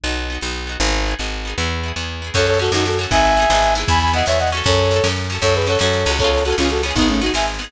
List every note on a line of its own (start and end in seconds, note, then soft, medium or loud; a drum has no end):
0.04 0.38 B1 medium
0.04 0.27 B3 medium
0.04 0.27 D#4 medium
0.09 0.27 F#4 medium
0.30 0.41 B3 medium
0.30 0.42 D#4 medium
0.35 0.42 F#4 medium
0.41 0.77 B1 medium
0.41 0.65 B3 medium
0.41 0.65 D#4 medium
0.46 0.65 F#4 medium
0.67 0.79 B3 medium
0.67 0.79 D#4 medium
0.72 0.79 F#4 medium
0.80 1.15 G#1 medium
0.80 1.04 B3 medium
0.80 1.04 D#4 medium
0.85 1.04 G#4 medium
1.06 1.18 B3 medium
1.06 1.18 D#4 medium
1.11 1.18 G#4 medium
1.19 1.54 G#1 medium
1.19 1.42 B3 medium
1.19 1.42 D#4 medium
1.23 1.42 G#4 medium
1.45 1.57 B3 medium
1.45 1.57 D#4 medium
1.50 1.57 G#4 medium
1.58 1.92 E2 medium
1.58 1.81 B3 medium
1.58 1.81 E4 medium
1.62 1.81 G#4 medium
1.83 1.95 B3 medium
1.83 1.95 E4 medium
1.88 1.95 G#4 medium
1.96 2.31 E2 medium
1.96 2.20 B3 medium
1.96 2.20 E4 medium
2.01 2.20 G#4 medium
2.22 2.34 B3 medium
2.22 2.34 E4 medium
2.27 2.34 G#4 medium
2.34 2.70 F#2 medium
2.34 2.58 C#4 loud
2.34 2.58 F#4 loud
2.34 2.46 A4 medium
2.34 2.46 C#5 loud
2.34 kick loud
2.34 snare loud
2.34 crash loud
2.39 2.58 A4 loud
2.39 snare medium
2.46 2.59 A4 loud
2.46 2.59 C#5 loud
2.46 snare medium
2.54 snare medium
2.59 2.71 C#4 medium
2.59 2.71 F#4 medium
2.59 2.71 A4 medium
2.59 snare medium
2.64 2.71 A4 medium
2.64 snare medium
2.72 3.06 F#2 medium
2.72 2.96 C#4 medium
2.72 2.85 D#4 medium
2.72 2.85 F#4 loud
2.72 2.96 F#4 medium
2.72 snare loud
2.77 2.96 A4 medium
2.77 snare medium
2.85 2.98 F#4 medium
2.85 2.98 A4 loud
2.85 snare loud
2.92 snare medium
2.99 3.10 C#4 medium
2.99 3.10 F#4 loud
2.99 snare medium
3.03 3.10 A4 medium
3.03 snare medium
3.11 3.46 G#1 medium
3.11 3.35 B3 loud
3.11 3.35 D#4 loud
3.11 3.74 E5 loud
3.11 3.74 G#5 loud
3.11 kick loud
3.11 snare medium
3.16 3.35 G#4 loud
3.16 snare medium
3.25 snare medium
3.31 snare medium
3.36 3.49 B3 medium
3.36 3.49 D#4 medium
3.36 snare medium
3.42 3.49 G#4 loud
3.42 snare medium
3.50 3.84 G#1 medium
3.50 3.74 B3 medium
3.50 3.74 D#4 loud
3.50 snare loud
3.55 3.74 G#4 loud
3.55 snare medium
3.62 snare medium
3.68 snare medium
3.75 4.12 B3 loud
3.75 4.12 E4 loud
3.75 snare medium
3.80 4.12 G#4 medium
3.80 snare medium
3.88 4.23 E2 medium
3.88 3.99 G#5 loud
3.88 3.99 B5 loud
3.88 kick loud
3.88 snare medium
3.95 snare medium
4.00 4.12 G#5 medium
4.00 4.12 B5 loud
4.00 snare medium
4.07 snare medium
4.13 4.25 B3 loud
4.13 4.25 E4 medium
4.13 4.25 D#5 medium
4.13 4.25 F#5 loud
4.13 snare medium
4.18 4.25 G#4 medium
4.18 snare medium
4.26 4.62 E2 medium
4.26 4.50 B3 loud
4.26 4.50 E4 medium
4.26 4.38 C#5 medium
4.26 4.38 E5 loud
4.26 snare loud
4.32 4.50 G#4 medium
4.32 snare medium
4.39 4.50 D#5 medium
4.39 4.50 F#5 loud
4.39 snare medium
4.47 snare medium
4.52 4.89 C#4 loud
4.52 4.89 F#4 loud
4.52 snare medium
4.57 4.89 A4 loud
4.57 snare medium
4.64 5.00 F#2 loud
4.64 5.07 A4 loud
4.64 5.07 C#5 loud
4.64 kick loud
4.64 snare medium
4.72 snare medium
4.78 snare medium
4.85 snare medium
4.91 5.03 C#4 medium
4.91 5.03 F#4 loud
4.91 snare loud
4.96 5.03 A4 medium
4.96 snare medium
5.04 5.38 F#2 medium
5.04 5.27 C#4 loud
5.04 5.27 F#4 loud
5.04 snare loud
5.08 5.27 A4 loud
5.08 snare medium
5.16 snare medium
5.24 snare medium
5.30 5.41 C#4 medium
5.30 5.42 F#4 medium
5.30 snare medium
5.35 5.42 A4 medium
5.35 snare medium
5.42 5.77 F#2 medium
5.42 5.65 C#4 loud
5.42 5.65 F#4 loud
5.42 5.54 A4 loud
5.42 5.54 C#5 loud
5.42 kick loud
5.42 snare medium
5.46 5.65 A4 loud
5.46 snare medium
5.54 5.67 G#4 medium
5.54 5.67 B4 medium
5.54 snare loud
5.61 snare medium
5.67 5.79 C#4 medium
5.67 5.79 F#4 loud
5.67 5.78 A4 loud
5.67 5.78 C#5 loud
5.67 snare loud
5.72 5.79 A4 medium
5.72 snare medium
5.79 6.05 F#2 medium
5.79 6.04 C#4 medium
5.79 6.11 A4 medium
5.79 6.11 C#5 medium
5.79 snare loud
5.83 6.04 F#4 medium
5.83 6.04 A4 medium
5.83 snare medium
5.93 snare loud
5.99 snare medium
6.06 6.54 C#2 medium
6.06 6.18 C#4 medium
6.06 6.18 F#4 medium
6.06 snare medium
6.11 6.18 A4 medium
6.11 snare medium
6.18 6.43 B3 loud
6.18 6.43 C#4 loud
6.18 6.31 A4 loud
6.18 6.31 C#5 loud
6.18 kick loud
6.18 snare medium
6.24 6.43 F4 loud
6.24 6.43 G#4 loud
6.24 snare medium
6.32 6.44 A4 medium
6.32 6.44 C#5 loud
6.32 snare medium
6.37 snare medium
6.45 6.57 B3 medium
6.45 6.57 C#4 medium
6.45 6.56 F#4 medium
6.45 6.56 A4 loud
6.45 snare medium
6.50 6.57 F4 medium
6.50 6.57 G#4 medium
6.50 snare medium
6.57 6.93 C#2 medium
6.57 6.81 B3 medium
6.57 6.69 C#4 medium
6.57 6.81 C#4 loud
6.57 6.69 F4 loud
6.57 snare loud
6.63 6.81 F4 medium
6.63 6.81 G#4 medium
6.63 snare medium
6.69 6.82 F#4 medium
6.69 6.82 A4 medium
6.69 snare loud
6.76 snare medium
6.83 6.95 B3 loud
6.83 6.95 C#4 loud
6.83 snare medium
6.88 6.95 F4 medium
6.88 6.95 G#4 medium
6.88 snare medium
6.96 7.30 G#1 medium
6.96 7.08 B3 loud
6.96 7.20 B3 loud
6.96 7.08 D#4 loud
6.96 7.20 D#4 loud
6.96 kick loud
6.96 snare medium
7.02 7.20 G#4 loud
7.02 snare medium
7.08 7.21 A3 medium
7.08 7.21 C#4 loud
7.08 snare medium
7.14 snare medium
7.21 7.33 B3 medium
7.21 7.32 D#4 medium
7.21 7.33 D#4 medium
7.21 7.32 F#4 medium
7.21 snare medium
7.26 7.33 G#4 loud
7.26 snare medium
7.34 7.68 G#1 medium
7.34 7.58 B3 medium
7.34 7.58 D#4 medium
7.34 7.46 E5 medium
7.34 7.46 G#5 medium
7.34 snare loud
7.40 7.58 G#4 medium
7.40 snare medium
7.48 snare medium
7.54 snare medium
7.59 7.71 B3 medium
7.59 7.71 D#4 medium
7.59 snare medium
7.64 7.71 G#4 loud
7.64 snare medium